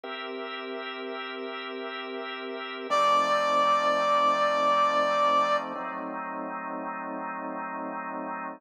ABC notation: X:1
M:4/4
L:1/8
Q:"Swing" 1/4=84
K:C
V:1 name="Brass Section"
z8 | d8 | z8 |]
V:2 name="Drawbar Organ"
[CG_Be]8 | [F,A,C_E]8 | [^F,A,C_E]8 |]